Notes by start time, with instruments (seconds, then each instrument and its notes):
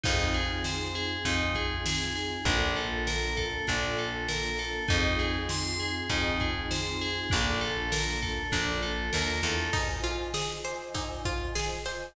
0.04 electric bass (finger) F2, pad 2 (warm) C4 D#4 F4 G#4, tubular bells D#4, kick, crash
0.34 tubular bells G#4, closed hi-hat
0.64 tubular bells C5, snare
0.94 tubular bells G#4, closed hi-hat
1.25 electric bass (finger) F2, tubular bells D#4, kick, closed hi-hat
1.55 tubular bells G#4, kick, closed hi-hat
1.86 tubular bells G#4, snare
2.15 tubular bells G#4, snare, open hi-hat
2.45 electric bass (finger) A#1, pad 2 (warm) A#3 D4 F4 A4, tubular bells D4, kick, closed hi-hat
2.76 tubular bells A4, closed hi-hat
3.07 tubular bells A#4, snare
3.37 tubular bells A4, kick, closed hi-hat
3.67 electric bass (finger) A#1, tubular bells D4, kick, closed hi-hat
3.97 tubular bells A4, closed hi-hat
4.28 tubular bells A#4, snare
4.58 tubular bells A4, snare, closed hi-hat
4.88 electric bass (finger) F2, pad 2 (warm) C4 D#4 F4 G#4, tubular bells D#4, kick, closed hi-hat
5.19 tubular bells G#4, snare, closed hi-hat
5.49 tubular bells C6, snare
5.80 tubular bells G#4, closed hi-hat
6.09 electric bass (finger) F2, tubular bells D#4, kick, closed hi-hat
6.40 tubular bells G#4, kick, closed hi-hat
6.71 tubular bells C5, snare
7.01 tubular bells G#4, snare, closed hi-hat
7.30 electric bass (finger) A#1, pad 2 (warm) A#3 D4 F4 A4, tubular bells D4, kick, closed hi-hat
7.61 tubular bells A4, closed hi-hat
7.92 tubular bells A#4, snare
8.21 tubular bells A4, kick, closed hi-hat
8.52 electric bass (finger) A#1, tubular bells D4, kick, closed hi-hat
8.82 tubular bells A4, closed hi-hat
9.13 electric bass (finger) D#2, tubular bells A#4, snare
9.43 electric bass (finger) E2, tubular bells A4, snare, closed hi-hat
9.73 pizzicato strings D#4, pad 2 (warm) F4 C5 D#5 G#5, kick, crash
9.90 pad 2 (warm) F4 C5 D#5 G#5
10.04 pizzicato strings F4, ride
10.34 pizzicato strings G#4, snare
10.51 pad 2 (warm) F4 C5 D#5 G#5
10.65 pad 2 (warm) F4 C5 D#5 G#5, pizzicato strings C5, ride
10.81 pad 2 (warm) F4 C5 D#5 G#5
10.94 pizzicato strings D#4, kick, ride
11.25 pizzicato strings F4, kick, ride
11.41 pad 2 (warm) F4 C5 D#5 G#5
11.55 pad 2 (warm) F4 C5 D#5 G#5, pizzicato strings G#4, snare
11.85 pad 2 (warm) F4 C5 D#5 G#5, pizzicato strings C5, snare, ride